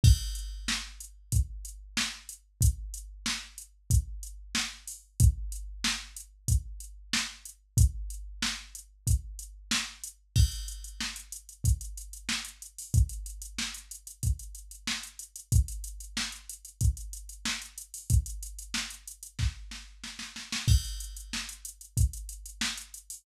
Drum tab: CC |x---------------|----------------|----------------|----------------|
HH |--x---x-x-x---x-|x-x---x-x-x---o-|x-x---x-x-x---x-|x-x---x-x-x---x-|
SD |----o-------o---|----o-------o---|----o-------o---|----o-------o---|
BD |o-------o-------|o-------o-------|o-------o-------|o-------o-------|

CC |x---------------|----------------|----------------|----------------|
HH |-xxx-xxxxxxx-xxo|xxxx-xxxxxxx-xxx|xxxx-xxxxxxx-xxo|xxxx-xxx--------|
SD |----o-------o---|----o-------o---|----o-------o---|----o---o-o-oooo|
BD |o-------o-------|o-------o-------|o-------o-------|o-------o-------|

CC |x---------------|
HH |-xxx-xxxxxxx-xxo|
SD |----o-------o---|
BD |o-------o-------|